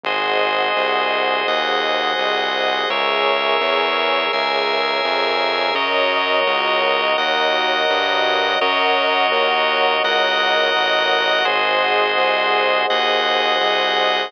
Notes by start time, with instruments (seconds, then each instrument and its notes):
0.04 synth bass 1 G#1, drawbar organ F#4 G#4 C5 D#5, pad 2 (warm) G#4 C5 D#5 F#5
0.76 synth bass 1 C2
1.47 synth bass 1 D#2, drawbar organ F#4 G#4 D#5 F#5
2.18 synth bass 1 C2
2.90 synth bass 1 C#2, pad 2 (warm) G#4 A#4 C#5 E5, drawbar organ G#4 A#4 C#5 E5
3.61 synth bass 1 E2
4.33 synth bass 1 C#2, drawbar organ G#4 A#4 E5 G#5
5.05 synth bass 1 F2
5.75 synth bass 1 F#2, drawbar organ F#4 A#4 C#5 D#5, pad 2 (warm) F#4 A#4 C#5 D#5
6.47 synth bass 1 C#2
7.18 synth bass 1 D#2, drawbar organ F#4 A#4 D#5 F#5
7.90 synth bass 1 G2
8.61 synth bass 1 F#2, drawbar organ F#4 A#4 C#5 D#5, pad 2 (warm) A#4 C#5 D#5 F#5
9.32 synth bass 1 D#2
10.04 synth bass 1 C#2, drawbar organ F#4 A#4 D#5 F#5
10.75 synth bass 1 A1
11.45 synth bass 1 G#1, drawbar organ F#4 G#4 C5 D#5, pad 2 (warm) G#4 C5 D#5 F#5
12.18 synth bass 1 C2
12.90 synth bass 1 D#2, drawbar organ F#4 G#4 D#5 F#5
13.61 synth bass 1 C2